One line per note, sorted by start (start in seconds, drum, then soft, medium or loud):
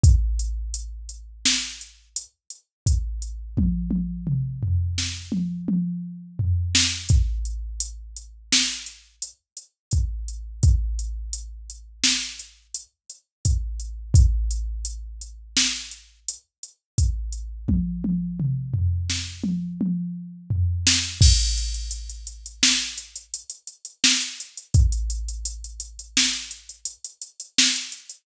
0.04 kick loud
0.04 closed hi-hat medium
0.39 closed hi-hat medium
0.74 closed hi-hat medium
1.09 closed hi-hat medium
1.45 snare loud
1.81 closed hi-hat medium
2.16 closed hi-hat loud
2.50 closed hi-hat medium
2.86 kick medium
2.86 closed hi-hat medium
3.22 closed hi-hat medium
3.57 kick medium
3.57 high tom medium
3.91 high tom medium
4.27 mid tom medium
4.63 floor tom medium
4.98 snare medium
5.32 high tom medium
5.68 high tom medium
6.39 floor tom medium
6.75 snare loud
7.09 kick medium
7.09 closed hi-hat medium
7.45 closed hi-hat medium
7.80 closed hi-hat loud
8.16 closed hi-hat medium
8.52 snare loud
8.86 closed hi-hat medium
9.22 closed hi-hat medium
9.57 closed hi-hat medium
9.91 kick medium
9.91 closed hi-hat medium
10.28 closed hi-hat medium
10.63 kick medium
10.63 closed hi-hat medium
10.99 closed hi-hat medium
11.33 closed hi-hat medium
11.70 closed hi-hat medium
12.04 snare loud
12.39 closed hi-hat medium
12.75 closed hi-hat loud
13.10 closed hi-hat medium
13.45 kick medium
13.45 closed hi-hat loud
13.80 closed hi-hat medium
14.14 kick loud
14.14 closed hi-hat medium
14.51 closed hi-hat medium
14.85 closed hi-hat medium
15.21 closed hi-hat medium
15.57 snare loud
15.91 closed hi-hat medium
16.29 closed hi-hat loud
16.63 closed hi-hat medium
16.98 kick medium
16.98 closed hi-hat medium
17.32 closed hi-hat medium
17.68 kick medium
17.68 high tom medium
18.04 high tom medium
18.40 mid tom medium
18.74 floor tom medium
19.10 snare medium
19.44 high tom medium
19.81 high tom medium
20.50 floor tom medium
20.87 snare loud
21.21 kick loud
21.21 crash loud
21.39 closed hi-hat medium
21.58 closed hi-hat medium
21.74 closed hi-hat medium
21.91 closed hi-hat medium
22.10 closed hi-hat medium
22.27 closed hi-hat medium
22.46 closed hi-hat medium
22.63 snare loud
22.80 closed hi-hat medium
22.98 closed hi-hat medium
23.16 closed hi-hat medium
23.34 closed hi-hat loud
23.50 closed hi-hat medium
23.67 closed hi-hat medium
23.85 closed hi-hat medium
24.04 snare loud
24.21 closed hi-hat medium
24.40 closed hi-hat medium
24.57 closed hi-hat medium
24.74 kick loud
24.74 closed hi-hat medium
24.92 closed hi-hat medium
25.10 closed hi-hat medium
25.29 closed hi-hat medium
25.45 closed hi-hat loud
25.64 closed hi-hat medium
25.80 closed hi-hat medium
25.99 closed hi-hat medium
26.17 snare loud
26.33 closed hi-hat medium
26.51 closed hi-hat medium
26.69 closed hi-hat medium
26.85 closed hi-hat loud
27.05 closed hi-hat medium
27.22 closed hi-hat medium
27.40 closed hi-hat medium
27.58 snare loud
27.76 closed hi-hat medium
27.92 closed hi-hat medium
28.10 closed hi-hat medium